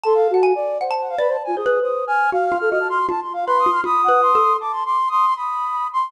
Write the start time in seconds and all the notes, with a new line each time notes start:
0.03 A4 A5 C6
0.15 F5
0.30 F#4 F#5 A5
0.43 G#5
0.55 D5
0.81 C5 F#5
0.91 A5
1.00 F#5
1.09 F5
1.18 B4 D5 B5
1.28 C5 A5
1.44 F4 G#5
1.56 G#4 C5 D#6
1.66 B4
1.82 C5 D#6
2.07 G#5 F6
2.32 F#4 F5 F6
2.45 F6
2.52 F4
2.58 A4 F6
2.70 F#4 D#5 F6
2.80 A5
2.90 C6 F6
3.09 F4 A5
3.21 C6
3.33 F5
3.47 B4 B5 C6
3.59 D#6
3.66 F4
3.72 F6
3.84 F4 B5 D#6
4.04 F#5
4.08 B4
4.22 C6
4.35 A4
4.60 A5 D6
4.73 C6
4.86 C6 D6
5.08 C6 D#6
5.27 C6
5.36 B5 D#6
5.93 B5 C6